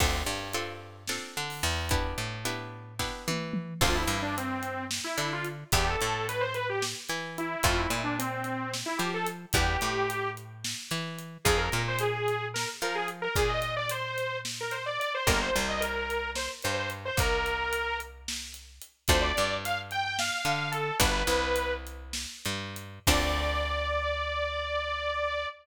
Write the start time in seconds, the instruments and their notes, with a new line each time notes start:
0.00 electric bass (finger) D2, pizzicato strings C4 D4 F4 A4, kick, crash
0.26 electric bass (finger) G2
0.53 pizzicato strings C4 D4 F4 A4, closed hi-hat
1.08 pizzicato strings C4 D4 F4 A4, snare
1.37 electric bass (finger) D3
1.50 open hi-hat
1.63 electric bass (finger) E2
1.89 pizzicato strings B3 D4 E4 G4, kick, closed hi-hat
2.18 electric bass (finger) A2
2.45 pizzicato strings B3 D4 E4 G4, closed hi-hat
2.99 pizzicato strings B3 D4 E4 G4, kick, snare
3.28 electric bass (finger) E3, high tom
3.53 mid tom
3.81 electric bass (finger) D2, pizzicato strings C4 D4 F4 A4, lead 2 (sawtooth) F4, kick, crash
3.95 lead 2 (sawtooth) E4
4.08 electric bass (finger) G2, closed hi-hat
4.22 lead 2 (sawtooth) D4
4.37 lead 2 (sawtooth) C4, closed hi-hat
4.63 closed hi-hat
4.91 snare
5.04 lead 2 (sawtooth) E4
5.18 electric bass (finger) D3, lead 2 (sawtooth) E4, closed hi-hat
5.33 lead 2 (sawtooth) F4
5.45 closed hi-hat
5.72 electric bass (finger) E2, pizzicato strings B3 D4 E4 G4, lead 2 (sawtooth) G4, kick, closed hi-hat
5.87 lead 2 (sawtooth) A4
6.01 electric bass (finger) A2, closed hi-hat
6.29 lead 2 (sawtooth) B4, closed hi-hat
6.41 lead 2 (sawtooth) C5
6.54 lead 2 (sawtooth) B4, closed hi-hat
6.69 lead 2 (sawtooth) G4
6.82 snare
7.09 electric bass (finger) E3, closed hi-hat
7.38 lead 2 (sawtooth) E4, closed hi-hat
7.63 electric bass (finger) F2, pizzicato strings A3 C4 E4 F4, lead 2 (sawtooth) F4, kick, closed hi-hat
7.78 lead 2 (sawtooth) E4
7.90 electric bass (finger) A#2, closed hi-hat
8.04 lead 2 (sawtooth) D4
8.19 lead 2 (sawtooth) C4, closed hi-hat
8.44 closed hi-hat
8.74 snare
8.86 lead 2 (sawtooth) E4
8.98 electric bass (finger) F3, lead 2 (sawtooth) G4, closed hi-hat
9.14 lead 2 (sawtooth) A4
9.26 closed hi-hat
9.53 electric bass (finger) E2, pizzicato strings G3 B3 D4 E4, lead 2 (sawtooth) G4, kick, closed hi-hat
9.81 electric bass (finger) A2, closed hi-hat
10.10 closed hi-hat
10.37 closed hi-hat
10.64 snare
10.91 electric bass (finger) E3, closed hi-hat
11.19 closed hi-hat
11.45 electric bass (finger) F2, pizzicato strings C4 D#4 F4 G#4, lead 2 (sawtooth) G#4, kick, closed hi-hat
11.58 lead 2 (sawtooth) A#4
11.72 electric bass (finger) A#2, closed hi-hat
11.88 lead 2 (sawtooth) C5
11.99 lead 2 (sawtooth) G#4, closed hi-hat
12.28 closed hi-hat
12.54 lead 2 (sawtooth) A#4, snare
12.82 electric bass (finger) F3, lead 2 (sawtooth) A#4, closed hi-hat
12.95 lead 2 (sawtooth) G#4
13.08 closed hi-hat
13.22 lead 2 (sawtooth) A#4
13.36 electric bass (finger) A#2, lead 2 (sawtooth) G#4, kick, closed hi-hat
13.49 lead 2 (sawtooth) D#5
13.62 closed hi-hat
13.77 lead 2 (sawtooth) D5
13.89 lead 2 (sawtooth) C5, closed hi-hat
14.18 closed hi-hat
14.45 snare
14.61 lead 2 (sawtooth) A#4
14.71 lead 2 (sawtooth) C5, closed hi-hat
14.86 lead 2 (sawtooth) D5
15.00 lead 2 (sawtooth) D5, closed hi-hat
15.14 lead 2 (sawtooth) C5
15.27 electric bass (finger) G1, pizzicato strings A#3 D4 F4 G4, lead 2 (sawtooth) A#4, kick, closed hi-hat
15.41 lead 2 (sawtooth) C5
15.56 electric bass (finger) C2, closed hi-hat
15.69 lead 2 (sawtooth) D#5
15.80 lead 2 (sawtooth) A#4, closed hi-hat
16.10 closed hi-hat
16.35 lead 2 (sawtooth) C5, snare
16.62 electric bass (finger) G2, lead 2 (sawtooth) C5, closed hi-hat
16.77 lead 2 (sawtooth) C5
16.90 closed hi-hat
17.05 lead 2 (sawtooth) C5
17.17 electric bass (finger) C2, lead 2 (sawtooth) A#4, kick, closed hi-hat
17.46 closed hi-hat
17.73 closed hi-hat
18.00 closed hi-hat
18.28 snare
18.54 closed hi-hat
18.81 closed hi-hat
19.08 electric bass (finger) D2, pizzicato strings A3 C4 D4 F4, lead 2 (sawtooth) C5, kick, closed hi-hat
19.21 lead 2 (sawtooth) D5
19.37 electric bass (finger) G2, closed hi-hat
19.65 lead 2 (sawtooth) F5, closed hi-hat
19.91 lead 2 (sawtooth) G5, closed hi-hat
20.05 lead 2 (sawtooth) G5
20.19 lead 2 (sawtooth) F5, snare
20.45 electric bass (finger) D3, closed hi-hat
20.72 lead 2 (sawtooth) A4, closed hi-hat
21.00 electric bass (finger) G1, pizzicato strings G3 B3 D4 F#4, lead 2 (sawtooth) B4, kick, closed hi-hat
21.27 electric bass (finger) C2, closed hi-hat
21.56 closed hi-hat
21.87 closed hi-hat
22.13 snare
22.45 electric bass (finger) G2, closed hi-hat
22.76 closed hi-hat
23.07 electric bass (finger) D2, pizzicato strings C4 D4 F4 A4, lead 2 (sawtooth) D5, kick, crash